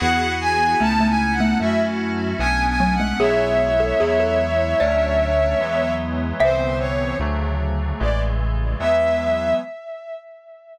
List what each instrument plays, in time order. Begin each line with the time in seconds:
0.00 synth bass 1 E2, electric piano 2 B3 E4 F#4 G#4, violin F#5
0.41 violin G#5
0.80 synth bass 1 C#2, xylophone A3, electric piano 2 B3 C#4 D#4 E4, violin A5
1.00 xylophone A3
1.09 violin G#5
1.33 violin F#5
1.40 xylophone A3
1.60 synth bass 1 F#2, xylophone A3, electric piano 2 A3 C#4 E4 F#4, violin E5
2.39 synth bass 1 B1, electric piano 2 A3 B3 C#4 D4, violin G#5
2.68 violin G#5
2.80 xylophone F#3
2.94 violin F#5
3.00 xylophone G#3
3.19 synth bass 1 B1, electric piano 2 F#3 G#3 B3 E4, xylophone G#4, violin C#5 E5
3.80 xylophone A4
4.00 synth bass 1 E2, electric piano 2 F#3 G#3 B3 E4, xylophone G#4
4.20 xylophone A4
4.80 synth bass 1 D2, electric piano 2 F#3 A3 C#4 D4, xylophone D5
5.59 synth bass 1 E2, electric piano 2 E3 F#3 G#3 B3
6.39 synth bass 1 C2, electric piano 2 D3 E3 B3 C4, violin C5, xylophone E5
6.79 violin C#5
7.19 synth bass 1 D2, electric piano 2 C#3 D3 F#3 A3
8.00 synth bass 1 A1, electric piano 2 C#3 E3 G#3 A3, violin D5
8.79 synth bass 1 E2, electric piano 2 E3 F#3 G#3 B3, violin E5